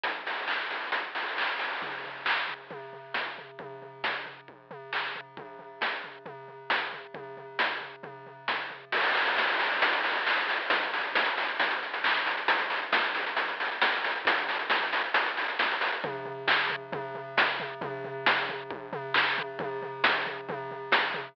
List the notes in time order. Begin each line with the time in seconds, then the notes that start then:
0.04 kick, closed hi-hat
0.27 open hi-hat
0.48 kick, clap
0.70 open hi-hat
0.92 kick, closed hi-hat
1.15 open hi-hat
1.37 kick, clap
1.59 open hi-hat
1.82 kick, floor tom
2.04 floor tom
2.25 kick, clap
2.48 floor tom
2.70 kick, floor tom
2.93 floor tom
3.14 kick, snare
3.38 floor tom
3.59 kick, floor tom
3.82 floor tom
4.04 kick, snare
4.26 floor tom
4.48 kick
4.71 floor tom
4.93 kick, clap
5.15 floor tom
5.37 kick, floor tom
5.59 floor tom
5.81 kick, snare
6.04 floor tom
6.26 kick, floor tom
6.48 floor tom
6.70 kick, snare
6.93 floor tom
7.14 kick, floor tom
7.37 floor tom
7.59 kick, snare
7.81 floor tom
8.03 kick, floor tom
8.26 floor tom
8.48 kick, snare
8.70 floor tom
8.92 kick, crash
9.04 closed hi-hat
9.15 open hi-hat
9.27 closed hi-hat
9.37 kick, snare
9.48 closed hi-hat
9.60 open hi-hat
9.72 closed hi-hat
9.82 kick, closed hi-hat
9.93 closed hi-hat
10.04 open hi-hat
10.16 closed hi-hat
10.26 kick, clap
10.37 closed hi-hat
10.49 open hi-hat
10.59 closed hi-hat
10.70 kick, closed hi-hat
10.82 closed hi-hat
10.94 open hi-hat
11.03 closed hi-hat
11.15 kick, snare
11.26 closed hi-hat
11.37 open hi-hat
11.48 closed hi-hat
11.60 kick, closed hi-hat
11.71 closed hi-hat
11.83 closed hi-hat
11.94 closed hi-hat
12.04 kick, clap
12.15 closed hi-hat
12.26 open hi-hat
12.37 closed hi-hat
12.48 kick, closed hi-hat
12.59 closed hi-hat
12.70 open hi-hat
12.82 closed hi-hat
12.92 kick, snare
13.04 closed hi-hat
13.15 open hi-hat
13.26 closed hi-hat
13.37 kick, closed hi-hat
13.48 closed hi-hat
13.60 open hi-hat
13.71 closed hi-hat
13.82 kick, snare
13.92 closed hi-hat
14.04 open hi-hat
14.15 closed hi-hat
14.25 kick, closed hi-hat
14.37 closed hi-hat
14.49 open hi-hat
14.59 closed hi-hat
14.70 kick, snare
14.83 closed hi-hat
14.93 open hi-hat
15.04 closed hi-hat
15.14 closed hi-hat
15.26 closed hi-hat
15.37 open hi-hat
15.48 closed hi-hat
15.59 kick, snare
15.71 closed hi-hat
15.81 open hi-hat
15.92 closed hi-hat
16.04 kick, floor tom
16.25 floor tom
16.48 kick, clap
16.70 floor tom
16.92 kick, floor tom
17.15 floor tom
17.37 kick, snare
17.60 floor tom
17.81 kick, floor tom
18.04 floor tom
18.26 kick, snare
18.49 floor tom
18.71 kick
18.93 floor tom
19.14 kick, clap
19.38 floor tom
19.59 kick, floor tom
19.82 floor tom
20.04 kick, snare
20.26 floor tom
20.49 kick, floor tom
20.71 floor tom
20.92 kick, snare
21.14 floor tom